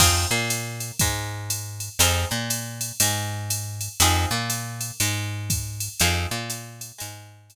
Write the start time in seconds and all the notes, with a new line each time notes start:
0.00 F2 C4 D#4 F4 G#4, kick, crash, ride
0.31 A#2 A#3
0.50 hi-hat pedal, ride
0.80 ride
0.99 G#2 G#3, kick, ride
1.50 hi-hat pedal, ride
1.80 ride
1.99 F2 C4 D#4 F4 G#4, ride
2.31 A#2 A#3
2.50 hi-hat pedal, ride
2.81 ride
3.00 G#2 G#3, ride
3.50 hi-hat pedal, ride
3.81 ride
4.00 F2 C4 D#4 F4 G#4, ride
4.31 A#2 A#3
4.50 hi-hat pedal, ride
4.81 ride
5.00 G#2 G#3, ride
5.50 kick, hi-hat pedal, ride
5.80 ride
6.00 F2 C4 D#4 F4 G#4, ride
6.31 A#2 A#3
6.50 hi-hat pedal, ride
6.81 ride
6.98 G#2 G#3, ride
7.50 hi-hat pedal, ride